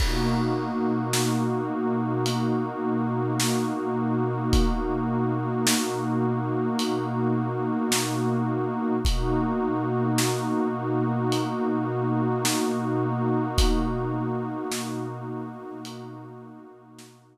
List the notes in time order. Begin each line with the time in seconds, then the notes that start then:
0.00 B2 A#3 D#4 F#4, kick, crash
1.13 snare
2.26 closed hi-hat
3.40 snare
4.53 kick, closed hi-hat
5.67 snare
6.79 closed hi-hat
7.92 snare
9.05 B2 A#3 D#4 F#4, kick, closed hi-hat
10.18 snare
11.32 closed hi-hat
12.45 snare
13.58 kick, closed hi-hat
14.71 snare
15.85 closed hi-hat
16.99 snare